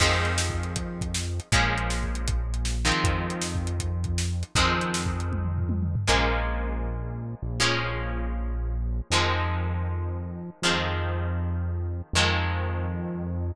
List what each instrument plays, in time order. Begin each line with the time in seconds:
0.00 synth bass 1 F2, acoustic guitar (steel) D#3 F3 G#3 C4, kick, crash
0.25 closed hi-hat
0.38 snare
0.50 kick
0.63 closed hi-hat
0.76 kick, closed hi-hat
1.01 kick, closed hi-hat
1.14 snare
1.40 closed hi-hat
1.52 synth bass 1 A#1, acoustic guitar (steel) F3 G#3 A#3 C#4, kick, closed hi-hat
1.78 closed hi-hat
1.90 snare
2.03 kick
2.15 closed hi-hat
2.28 kick, closed hi-hat
2.54 closed hi-hat
2.65 snare
2.85 acoustic guitar (steel) D#3 F3 G#3 C4
2.92 closed hi-hat
3.04 synth bass 1 F2, kick, closed hi-hat
3.30 closed hi-hat
3.42 snare
3.55 kick
3.67 closed hi-hat
3.80 kick, closed hi-hat
4.04 kick, closed hi-hat
4.18 snare
4.43 closed hi-hat
4.55 synth bass 1 F2, acoustic guitar (steel) D#3 F3 G#3 C4, kick, closed hi-hat
4.81 closed hi-hat
4.94 snare
5.06 kick
5.20 closed hi-hat
5.32 kick, high tom
5.44 mid tom
5.58 floor tom
5.69 high tom
5.82 mid tom
5.95 floor tom
6.07 synth bass 1 A#1, acoustic guitar (steel) F3 G#3 A#3 C#4
7.42 synth bass 1 A#1
7.60 acoustic guitar (steel) F3 G#3 A#3 C#4
9.10 synth bass 1 F2, acoustic guitar (steel) D#3 F3 G#3 C4
10.62 synth bass 1 F2, acoustic guitar (steel) D#3 F3 G#3 C4
12.13 synth bass 1 F2, acoustic guitar (steel) D#3 F3 G#3 C4